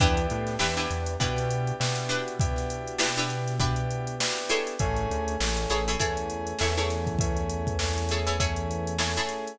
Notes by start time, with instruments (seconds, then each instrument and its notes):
0.00 synth bass 1 E2, electric piano 2 B3 D4 E4 G4, pizzicato strings D4 E4 G4 B4, kick, closed hi-hat
0.17 closed hi-hat
0.30 synth bass 1 A2, closed hi-hat
0.47 snare, closed hi-hat
0.59 synth bass 1 E2, electric piano 2 B3 D4 E4 G4, pizzicato strings D4 E4 G4 B4, snare
0.77 pizzicato strings D4 E4 G4 B4, closed hi-hat
0.91 synth bass 1 E2, closed hi-hat
1.06 closed hi-hat
1.20 synth bass 1 B2, electric piano 2 B3 D4 E4 G4, pizzicato strings D4 E4 G4 B4, kick, closed hi-hat
1.36 snare, closed hi-hat
1.51 closed hi-hat
1.67 closed hi-hat
1.80 synth bass 1 B2, electric piano 2 B3 D4 E4 G4, snare
1.96 closed hi-hat
2.09 pizzicato strings D4 E4 G4 B4, closed hi-hat
2.28 closed hi-hat
2.40 electric piano 2 B3 D4 E4 G4, kick, closed hi-hat
2.56 snare, closed hi-hat
2.70 closed hi-hat
2.88 closed hi-hat
2.98 electric piano 2 B3 D4 E4 G4, pizzicato strings D4 E4 G4 B4, snare
3.16 pizzicato strings D4 E4 G4 B4, snare, closed hi-hat
3.30 closed hi-hat
3.48 snare, closed hi-hat
3.60 electric piano 2 B3 D4 E4 G4, pizzicato strings D4 E4 G4 B4, kick, closed hi-hat
3.76 closed hi-hat
3.91 closed hi-hat
4.07 closed hi-hat
4.20 electric piano 2 B3 D4 E4 G4, snare
4.37 closed hi-hat
4.49 pizzicato strings E4 G#4 A4 C#5, snare, closed hi-hat
4.67 snare, closed hi-hat
4.79 synth bass 1 A1, electric piano 2 A3 C#4 E4 G#4, kick, closed hi-hat
4.96 closed hi-hat
5.11 synth bass 1 D2, closed hi-hat
5.28 closed hi-hat
5.40 synth bass 1 A1, electric piano 2 A3 C#4 E4 G#4, snare
5.57 closed hi-hat
5.70 synth bass 1 A1, pizzicato strings E4 G#4 A4 C#5, closed hi-hat
5.88 pizzicato strings E4 G#4 A4 C#5, closed hi-hat
6.00 synth bass 1 E2, electric piano 2 A3 C#4 E4 G#4, pizzicato strings E4 G#4 A4 C#5, kick, closed hi-hat
6.17 closed hi-hat
6.30 closed hi-hat
6.47 closed hi-hat
6.59 synth bass 1 E2, electric piano 2 A3 C#4 E4 G#4, pizzicato strings E4 G#4 A4 C#5, snare
6.77 pizzicato strings E4 G#4 A4 C#5, closed hi-hat
6.90 snare, closed hi-hat
7.07 kick, closed hi-hat
7.19 electric piano 2 A3 C#4 E4 G#4, kick, closed hi-hat
7.37 closed hi-hat
7.50 closed hi-hat
7.67 kick, closed hi-hat
7.79 electric piano 2 A3 C#4 E4 G#4, snare
7.98 closed hi-hat
8.09 pizzicato strings E4 G#4 A4 C#5, snare, closed hi-hat
8.27 pizzicato strings E4 G#4 A4 C#5, closed hi-hat
8.39 electric piano 2 A3 C#4 E4 G#4, pizzicato strings E4 G#4 A4 C#5, kick, closed hi-hat
8.56 closed hi-hat
8.71 closed hi-hat
8.87 closed hi-hat
8.98 electric piano 2 A3 C#4 E4 G#4, pizzicato strings E4 G#4 A4 C#5, snare
9.17 pizzicato strings E4 G#4 A4 C#5, closed hi-hat
9.29 closed hi-hat
9.47 closed hi-hat